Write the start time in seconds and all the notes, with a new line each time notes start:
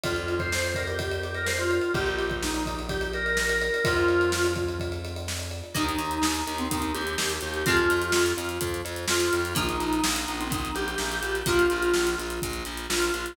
0.03 F2 F4, kick, ride
0.16 ride
0.28 ride
0.39 C5, kick, ride
0.52 snare
0.64 ride
0.75 A#4, kick, ride
0.87 G4, ride
0.99 kick, ride
1.11 ride
1.23 G4, ride
1.34 A#4, ride
1.46 C5, snare
1.59 F4, ride
1.71 ride
1.81 ride
1.94 A#1 G4, kick, ride
2.06 ride
2.18 ride
2.30 kick, ride
2.43 D#4, snare
2.54 ride
2.66 kick, ride
2.79 ride
2.89 G4, kick, ride
3.01 ride
3.13 A#4, ride
3.26 ride
3.37 snare
3.49 ride
3.61 A#4, ride
3.74 ride
3.85 F2 F4, kick, ride
3.97 ride
4.08 ride
4.21 ride
4.32 snare
4.44 ride
4.56 kick, ride
4.68 ride
4.80 kick, ride
4.92 ride
5.05 ride
5.16 ride
5.28 snare
5.39 ride
5.51 ride
5.63 ride
5.75 D#2 D#3 A#3 D#4, kick, closed hi-hat
5.89 closed hi-hat
5.98 D#2, closed hi-hat
6.11 closed hi-hat
6.22 D#2 D#4, snare
6.35 closed hi-hat
6.47 D#2, closed hi-hat
6.58 C4, closed hi-hat
6.70 D#2 D#4, kick, closed hi-hat
6.82 closed hi-hat
6.94 D#2 G4, closed hi-hat
7.07 closed hi-hat
7.18 D#2, snare
7.30 closed hi-hat
7.41 D#2 G4, closed hi-hat
7.54 closed hi-hat
7.66 F2 F3 G#3 C4 F4, kick, closed hi-hat
7.77 closed hi-hat
7.90 F2, closed hi-hat
8.02 closed hi-hat
8.12 F2, snare
8.26 closed hi-hat
8.37 F2, closed hi-hat
8.49 closed hi-hat
8.61 F2, kick, closed hi-hat
8.74 closed hi-hat
8.85 F2, closed hi-hat
8.96 closed hi-hat
9.08 F2 F4, snare
9.20 closed hi-hat
9.33 F2, closed hi-hat
9.45 closed hi-hat
9.55 A#1 F3 A#3 D#4, kick, closed hi-hat
9.69 closed hi-hat
9.80 A#1, closed hi-hat
9.93 closed hi-hat
10.03 A#1 D#4, snare
10.16 closed hi-hat
10.28 A#1, closed hi-hat
10.40 C4, closed hi-hat
10.50 A#1 D#4, kick, closed hi-hat
10.65 closed hi-hat
10.75 A#1 G4, closed hi-hat
10.88 closed hi-hat
10.98 A#1, snare
11.12 closed hi-hat
11.22 A#1 G4, closed hi-hat
11.35 closed hi-hat
11.46 A#1 F3 A#3 F4, kick, closed hi-hat
11.59 closed hi-hat
11.70 A#1, closed hi-hat
11.82 closed hi-hat
11.94 A#1, snare
12.07 closed hi-hat
12.18 A#1, closed hi-hat
12.30 closed hi-hat
12.42 A#1, kick, closed hi-hat
12.53 closed hi-hat
12.65 A#1, closed hi-hat
12.77 closed hi-hat
12.90 A#1 F4, snare
13.02 closed hi-hat
13.14 A#1, closed hi-hat
13.26 closed hi-hat